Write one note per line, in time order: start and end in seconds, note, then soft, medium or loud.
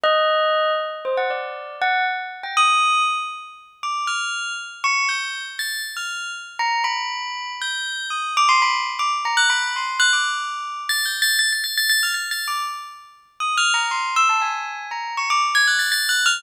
0.03 0.72 D#5 loud
1.05 1.16 C5 medium
1.17 1.29 F#5 medium
1.30 1.76 D5 medium
1.82 2.04 F#5 loud
2.43 2.55 G5 medium
2.57 3.02 D#6 loud
3.83 4.06 D6 medium
4.07 4.53 F6 medium
4.84 5.07 C#6 loud
5.09 5.43 G6 medium
5.59 5.82 A6 medium
5.97 6.31 F6 medium
6.59 6.82 A#5 medium
6.84 7.52 B5 medium
7.61 8.07 G6 medium
8.10 8.33 D#6 medium
8.37 8.48 D6 loud
8.49 8.60 C6 loud
8.62 8.73 B5 loud
8.99 9.11 D6 medium
9.25 9.36 A#5 medium
9.37 9.48 F#6 loud
9.50 9.72 B5 medium
9.76 9.99 C6 medium
9.99 10.11 F#6 loud
10.13 10.81 D6 medium
10.89 11.04 A6 loud
11.05 11.21 G6 medium
11.22 11.37 A6 loud
11.39 11.50 A6 loud
11.53 11.63 A6 medium
11.64 11.75 A6 medium
11.77 11.89 A6 loud
11.89 12.01 A6 loud
12.03 12.14 F6 medium
12.14 12.29 A6 medium
12.31 12.46 A6 medium
12.48 12.63 D6 medium
13.40 13.55 D#6 medium
13.57 13.73 F6 loud
13.74 13.89 A#5 medium
13.91 14.14 C6 medium
14.16 14.28 E6 loud
14.29 14.41 A5 medium
14.41 14.87 G#5 medium
14.91 15.14 A#5 medium
15.17 15.29 C#6 medium
15.30 15.41 D6 loud
15.55 15.66 G#6 loud
15.67 15.79 F#6 medium
15.79 15.90 A6 medium
15.92 16.07 A6 loud
16.09 16.24 F#6 medium
16.26 16.41 F6 loud